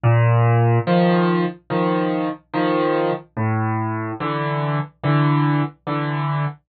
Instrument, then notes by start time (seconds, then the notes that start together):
acoustic grand piano
0.03 A#2
0.87 D#3 F3
1.70 D#3 F3
2.53 D#3 F3
3.37 A2
4.20 D3 E3
5.03 D3 E3
5.87 D3 E3